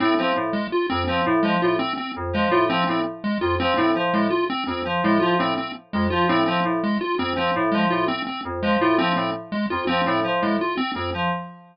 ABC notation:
X:1
M:9/8
L:1/8
Q:3/8=111
K:none
V:1 name="Electric Piano 2" clef=bass
A,, F, A,, z2 F,, F, A,, F, | A,, z2 F,, F, A,, F, A,, z | z F,, F, A,, F, A,, z2 F,, | F, A,, F, A,, z2 F,, F, A,, |
F, A,, z2 F,, F, A,, F, A,, | z2 F,, F, A,, F, A,, z2 | F,, F, A,, F, A,, z2 F,, F, |]
V:2 name="Lead 1 (square)"
C C z _A, F C C z A, | F C C z _A, F C C z | _A, F C C z A, F C C | z _A, F C C z A, F C |
C z _A, F C C z A, F | C C z _A, F C C z A, | F C C z _A, F C C z |]